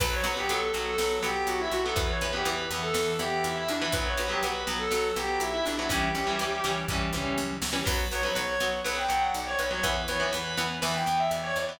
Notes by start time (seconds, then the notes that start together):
0.00 B1 F#3 B3 B4, kick, crash
0.13 C#5
0.24 B1 F#3 B3 B4, closed hi-hat
0.37 F#3 B3 G4
0.49 B1 F#3 B3 A4, closed hi-hat
0.74 B1 F#3 B3, snare, closed hi-hat
0.86 A4
0.98 B1 F#3 B3, snare
1.23 B1 F#3 B3 G4, closed hi-hat
1.47 B1 F#4, closed hi-hat
1.60 E4
1.72 B1 F#4, closed hi-hat
1.84 F#3 B3 A4
1.96 E2 E3 B3 B4, kick, closed hi-hat
2.09 C#5
2.21 E2 E3 B3 B4, closed hi-hat
2.33 E3 B3 G4
2.45 E2 E3 B3 B4, closed hi-hat
2.70 E2 E3 B3, snare, closed hi-hat
2.83 A4
2.94 E2 E3 B3, snare
3.19 E2 E3 B3 G4, closed hi-hat
3.44 E2 E4, closed hi-hat
3.56 E4
3.68 E2 D4, closed hi-hat
3.81 E3 B3 E4
3.92 B1 F#3 B3 B4, kick, closed hi-hat
4.06 C#5
4.17 B1 F#3 B3 B4, closed hi-hat
4.29 F#3 B3 G4
4.43 B1 F#3 B3 B4, closed hi-hat
4.67 B1 F#3 B3, snare, closed hi-hat
4.79 A4
4.91 B1 F#3 B3, snare
5.16 B1 F#3 B3 G4, closed hi-hat
5.40 B1 E4, closed hi-hat
5.53 E4
5.66 B1 D4, closed hi-hat
5.78 F#3 B3 E4
5.89 C#2 E3 G3 C#4 G4, kick, closed hi-hat
6.15 C#2 E3 G3 C#4, closed hi-hat
6.27 E3 G3 C#4
6.39 C#2 E3 G3 C#4, closed hi-hat
6.64 C#2 E3 G3 C#4, snare, closed hi-hat
6.88 C#2 E3 G3 C#4, kick, floor tom
7.13 C#2 E3 G3 C#4, mid tom
7.38 C#2, high tom
7.62 C#2, snare
7.73 E3 G3 C#4
7.86 B1 F#3 B3 B4, kick, crash
8.11 B1 F#3 B3 C#5, closed hi-hat
8.23 F#3 B3 B4
8.35 B1 F#3 B3 C#5, closed hi-hat
8.60 B1 F#3 B3, snare, closed hi-hat
8.84 B1 F#3 B3 B4, snare
8.97 G5
9.09 B1 F#3 B3, closed hi-hat
9.22 F#5
9.34 B1 D5, closed hi-hat
9.46 C#5
9.59 B1 B4, closed hi-hat
9.71 F#3 B3 C#5
9.83 E2 E3 B3 B4, kick, closed hi-hat
10.08 E2 E3 B3 C#5, closed hi-hat
10.20 E3 B3 B4
10.33 E2 E3 B3 B4, closed hi-hat
10.57 E2 E3 B3, snare, closed hi-hat
10.82 E2 E3 B3 B4, snare
10.94 G5
11.06 E2 E3 B3, closed hi-hat
11.19 E5
11.31 E2 D5, closed hi-hat
11.43 C#5
11.55 E2 D5, closed hi-hat
11.68 E3 B3 D5